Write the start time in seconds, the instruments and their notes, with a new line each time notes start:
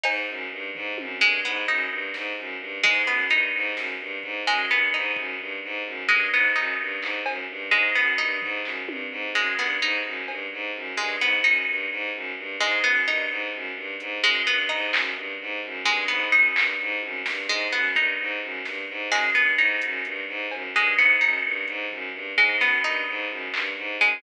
0.03 violin G#2, pizzicato strings D#4, cowbell
0.28 violin F#2
0.51 violin G2
0.75 violin G#2, floor tom
0.98 violin F#2, high tom
1.21 violin G2, pizzicato strings G#3
1.44 violin G#2, pizzicato strings B3
1.68 violin F#2, pizzicato strings D#4, floor tom
1.90 violin G2
2.14 violin G#2, snare
2.37 violin F#2
2.60 violin G2
2.84 violin G#2, pizzicato strings G#3, floor tom
3.07 violin F#2, pizzicato strings B3
3.30 violin G2, pizzicato strings D#4, closed hi-hat
3.54 violin G#2
3.76 violin F#2, snare
3.99 violin G2
4.23 violin G#2, kick
4.47 violin F#2, pizzicato strings G#3
4.70 violin G2, pizzicato strings B3
4.93 violin G#2, pizzicato strings D#4
5.16 violin F#2, kick
5.39 violin G2, kick
5.64 violin G#2
5.85 violin F#2
6.09 violin G2, pizzicato strings G#3
6.32 violin G#2, pizzicato strings B3
6.56 violin F#2, pizzicato strings D#4
6.79 violin G2
7.01 violin G#2, clap
7.26 violin F#2, cowbell
7.49 violin G2
7.71 violin G#2, pizzicato strings G#3
7.95 violin F#2, pizzicato strings B3
8.18 violin G2, pizzicato strings D#4
8.42 violin G#2, floor tom
8.64 violin F#2, clap
8.87 violin G2, high tom
9.11 violin G#2
9.35 violin F#2, pizzicato strings G#3
9.58 violin G2, pizzicato strings B3, clap
9.82 violin G#2, pizzicato strings D#4
10.05 violin F#2
10.28 violin G2, cowbell
10.52 violin G#2
10.75 violin F#2
10.97 violin G2, pizzicato strings G#3
11.20 violin G#2, pizzicato strings B3
11.44 violin F#2, pizzicato strings D#4
11.67 violin G2
11.91 violin G#2
12.14 violin F#2
12.37 violin G2
12.60 violin G#2, pizzicato strings G#3
12.84 violin F#2, pizzicato strings B3
13.07 violin G2, pizzicato strings D#4
13.30 violin G#2
13.53 violin F#2
13.76 violin G2
14.00 violin G#2, closed hi-hat
14.23 violin F#2, pizzicato strings G#3, closed hi-hat
14.47 violin G2, pizzicato strings B3
14.69 violin G#2, pizzicato strings D#4, floor tom
14.92 violin F#2, clap
15.15 violin G2
15.40 violin G#2
15.63 violin F#2, kick
15.85 violin G2, pizzicato strings G#3, high tom
16.08 violin G#2, pizzicato strings B3
16.32 violin F#2, pizzicato strings D#4
16.56 violin G2, clap
16.79 violin G#2
17.02 violin F#2, high tom
17.26 violin G2, snare
17.49 violin G#2, pizzicato strings G#3
17.72 violin F#2, pizzicato strings B3
17.95 violin G2, pizzicato strings D#4, kick
18.20 violin G#2
18.42 violin F#2
18.65 violin G2, snare
18.89 violin G#2
19.11 violin F#2, pizzicato strings G#3, clap
19.35 violin G2, pizzicato strings B3
19.58 violin G#2, pizzicato strings D#4
19.82 violin F#2, closed hi-hat
20.05 violin G2, closed hi-hat
20.28 violin G#2
20.51 violin F#2, cowbell
20.75 violin G2, pizzicato strings G#3, clap
20.97 violin G#2, pizzicato strings B3
21.21 violin F#2, pizzicato strings D#4
21.44 violin G2
21.68 violin G#2, closed hi-hat
21.91 violin F#2, floor tom
22.13 violin G2
22.38 violin G#2, pizzicato strings G#3
22.60 violin F#2, pizzicato strings B3, snare
22.83 violin G2, pizzicato strings D#4
23.08 violin G#2
23.29 violin F#2
23.54 violin G2, clap
23.77 violin G#2
24.01 violin F#2, pizzicato strings G#3